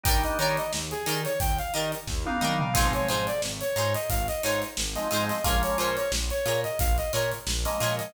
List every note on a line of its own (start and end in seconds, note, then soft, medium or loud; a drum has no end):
0.04 0.25 D#2 medium
0.04 0.59 G3 loud
0.04 0.59 A#3 loud
0.04 0.59 D4 loud
0.04 0.59 D#4 loud
0.04 0.18 D#4 loud
0.04 0.18 G4 loud
0.04 0.18 A#4 loud
0.04 0.23 G5 medium
0.04 kick loud
0.04 closed hi-hat loud
0.09 0.18 D5 loud
0.24 0.38 D#5 medium
0.24 closed hi-hat medium
0.39 0.59 D#3 medium
0.39 0.63 D#4 medium
0.39 0.63 G4 medium
0.39 0.63 A#4 loud
0.39 0.56 C#5 medium
0.39 0.63 D5 loud
0.39 closed hi-hat medium
0.57 0.72 D#5 medium
0.57 closed hi-hat medium
0.73 0.94 D#2 medium
0.73 snare loud
0.91 1.21 G#4 medium
0.91 closed hi-hat medium
1.06 1.27 D#3 medium
1.06 1.31 D#4 loud
1.06 1.31 G4 medium
1.06 1.31 A#4 loud
1.06 1.31 D5 loud
1.06 closed hi-hat loud
1.25 1.39 C#5 medium
1.25 closed hi-hat medium
1.40 1.61 D#2 medium
1.40 1.58 G5 medium
1.40 kick loud
1.40 closed hi-hat loud
1.59 1.73 F5 medium
1.59 closed hi-hat medium
1.74 1.95 D#3 medium
1.74 1.98 D#4 medium
1.74 1.98 G4 medium
1.74 1.98 A#4 loud
1.74 1.98 D5 medium
1.74 1.91 D#5 medium
1.74 closed hi-hat medium
1.92 closed hi-hat medium
2.07 2.28 D#2 medium
2.07 kick medium
2.07 snare medium
2.26 2.38 G3 medium
2.26 2.38 A#3 medium
2.26 2.38 D4 loud
2.26 2.38 D#4 loud
2.26 2.58 F5 medium
2.26 high tom loud
2.41 2.62 D#3 medium
2.41 2.69 G3 loud
2.41 2.69 A#3 medium
2.41 2.69 D4 medium
2.41 2.54 D#4 loud
2.41 2.69 D#4 medium
2.41 2.54 G4 medium
2.41 2.54 A#4 loud
2.41 2.54 D5 loud
2.41 mid tom medium
2.60 2.74 F5 medium
2.60 floor tom loud
2.73 2.96 G#1 medium
2.73 3.29 F3 loud
2.73 3.29 G#3 loud
2.73 3.29 C4 loud
2.73 3.29 D#4 loud
2.73 2.88 D#4 loud
2.73 2.88 F4 loud
2.73 2.88 G#4 loud
2.73 2.92 F5 medium
2.73 kick loud
2.73 crash loud
2.78 2.88 C5 loud
2.93 3.08 C#5 medium
2.93 closed hi-hat medium
3.09 3.29 G#2 medium
3.09 3.33 D#4 medium
3.09 3.33 F4 loud
3.09 3.33 G#4 loud
3.09 3.26 C5 medium
3.09 3.33 C5 medium
3.09 closed hi-hat medium
3.27 3.42 D5 medium
3.27 closed hi-hat medium
3.42 3.63 G#1 medium
3.42 snare loud
3.61 3.94 C#5 medium
3.61 closed hi-hat medium
3.76 3.96 G#2 medium
3.76 4.01 D#4 medium
3.76 4.01 F4 loud
3.76 4.01 G#4 loud
3.76 4.01 C5 loud
3.76 closed hi-hat medium
3.95 4.09 D#5 medium
3.95 closed hi-hat medium
4.10 4.30 G#1 medium
4.10 4.27 F5 medium
4.10 kick loud
4.10 closed hi-hat loud
4.28 4.43 D#5 medium
4.28 closed hi-hat medium
4.43 4.64 G#2 medium
4.43 4.68 D#4 loud
4.43 4.68 F4 medium
4.43 4.68 G#4 medium
4.43 4.68 C5 medium
4.43 4.61 C#5 medium
4.43 closed hi-hat medium
4.62 snare soft
4.62 closed hi-hat medium
4.77 4.98 G#1 medium
4.77 snare loud
4.96 5.08 F3 loud
4.96 5.08 G#3 loud
4.96 5.08 C4 medium
4.96 5.08 D#4 loud
4.96 5.25 D#5 medium
4.96 snare soft
4.96 closed hi-hat medium
5.11 5.32 G#2 medium
5.11 5.38 F3 medium
5.11 5.38 G#3 loud
5.11 5.38 C4 medium
5.11 5.38 D#4 medium
5.11 5.24 D#4 medium
5.11 5.24 F4 medium
5.11 5.24 G#4 loud
5.11 5.24 C5 loud
5.11 closed hi-hat loud
5.29 5.44 D#5 medium
5.29 snare medium
5.29 closed hi-hat medium
5.44 5.65 A#1 medium
5.44 5.99 F3 loud
5.44 5.99 G#3 loud
5.44 5.99 A#3 loud
5.44 5.99 C#4 loud
5.44 5.57 F4 loud
5.44 5.57 G#4 loud
5.44 5.57 A#4 loud
5.44 5.62 F5 medium
5.44 kick loud
5.44 closed hi-hat loud
5.48 5.57 C#5 medium
5.63 5.78 C#5 medium
5.63 closed hi-hat medium
5.78 5.98 A#2 medium
5.78 6.03 F4 medium
5.78 6.03 G#4 medium
5.78 6.03 A#4 medium
5.78 5.96 C5 medium
5.78 6.03 C#5 medium
5.78 closed hi-hat medium
5.97 6.11 C#5 medium
5.97 snare soft
5.97 closed hi-hat medium
6.12 6.32 A#1 medium
6.12 snare loud
6.30 6.61 C#5 medium
6.30 closed hi-hat medium
6.46 6.66 A#2 medium
6.46 6.70 F4 loud
6.46 6.70 G#4 medium
6.46 6.70 A#4 loud
6.46 6.70 C#5 medium
6.46 closed hi-hat medium
6.64 6.79 D#5 medium
6.64 closed hi-hat medium
6.79 7.00 A#1 medium
6.79 6.97 F5 medium
6.79 kick loud
6.79 closed hi-hat loud
6.98 7.12 D#5 medium
6.98 closed hi-hat medium
7.13 7.34 A#2 medium
7.13 7.38 F4 medium
7.13 7.38 G#4 medium
7.13 7.38 A#4 medium
7.13 7.31 C#5 medium
7.13 7.38 C#5 medium
7.13 snare soft
7.13 closed hi-hat medium
7.32 closed hi-hat medium
7.47 7.67 A#1 medium
7.47 snare loud
7.65 7.77 F3 medium
7.65 7.77 G#3 medium
7.65 7.77 A#3 loud
7.65 7.77 C#4 medium
7.65 7.96 D#5 medium
7.65 snare soft
7.65 closed hi-hat medium
7.80 8.01 A#2 medium
7.80 8.08 F3 medium
7.80 8.08 G#3 medium
7.80 8.08 A#3 medium
7.80 8.08 C#4 medium
7.80 7.93 F4 loud
7.80 7.93 G#4 medium
7.80 7.93 A#4 loud
7.80 7.93 C#5 medium
7.80 closed hi-hat medium
7.99 8.13 D#5 medium
7.99 snare medium
7.99 closed hi-hat medium